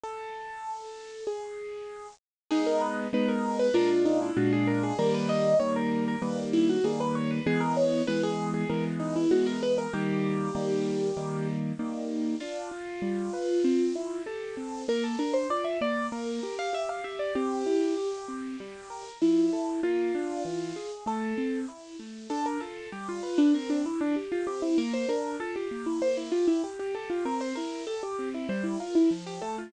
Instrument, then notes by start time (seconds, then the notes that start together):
acoustic grand piano
0.03 A4
1.27 G#4
2.51 G#3 B3 D#4 G#4
2.66 A#4
2.81 B4
3.13 G#3 B3 D#4 B4
3.28 A#4
3.59 B4
3.74 A#2 G#3 D4 F4 A#4
4.05 D#4
4.22 E4
4.36 A#2 G#3 D4 F4 F#4
4.53 G#4
4.67 A#4
4.83 G#4
4.98 D#3 G3 A#3 A#4
5.14 B4
5.29 D#5
5.60 D#3 G3 A#3 C#5
5.76 A#4
6.08 A#4
6.22 D#3 G3 A#3 B4
6.53 E4
6.69 F#4
6.84 D#3 G3 A#3 G#4
7.00 B4
7.15 C#5
7.31 B4
7.46 E3 G#3 B3 G#4
7.60 A#4
7.77 C#5
8.07 E3 G#3 B3 B4
8.23 G#4
8.54 G#4
8.69 E3 G#3 B3 A#4
8.99 D#4
9.16 E4
9.31 E3 G#3 B3 F#4
9.47 A#4
9.63 B4
9.78 A#4
9.93 D#3 G3 A#3 G4
10.55 D#3 G3 A#3
11.17 D#3 G3 A#3
11.79 D#3 G3 A#3
12.40 D4 F4
12.71 F4
13.02 G3
13.33 B4
13.64 C4
13.95 E4
14.26 G4 A4
14.57 C4
14.88 A#3 A#4
15.04 A4
15.19 D4 A#4
15.34 C5
15.50 F4 D5
15.64 E5
15.81 A#3 D5
16.12 A#3 A#4
16.43 G4
16.59 F5
16.73 G4 E5
16.89 F5
17.04 G4 E5
17.19 D5
17.35 C4 G4
17.66 E4
17.97 G4
18.28 C4
18.60 G3
18.90 A#4
19.21 F3 E4
19.53 A4
19.83 A#3 F4
20.15 D4
20.45 E3
20.76 G#4
21.06 A3 A4
21.38 C4
21.68 E4
21.99 A3
22.30 D4 A4
22.46 A#4
22.60 F4 A4
22.92 G3 G4
23.09 F4
23.23 B4
23.38 D4
23.54 C4 A#4
23.70 D4
23.85 E3 E4
24.01 D4
24.16 G4
24.32 F4
24.47 C4 G4
24.62 E4
24.78 A#3 A#4
24.93 C5
25.08 D4 A#4
25.40 F4 A4
25.56 G4
25.71 A#3
25.86 E4
26.02 A#3 C5
26.17 E4
26.32 F4 G4
26.47 E4
26.64 G4
26.79 G4
26.95 G4 A4
27.10 F4
27.25 C4 A#4
27.41 C5
27.55 E4 A#4
27.87 G4 A4
28.03 G4
28.19 C4
28.34 E4
28.49 G3 C5
28.64 E4
28.80 F4 A#4
28.95 E4
29.11 F3
29.26 G4
29.41 A3 A4
29.58 F4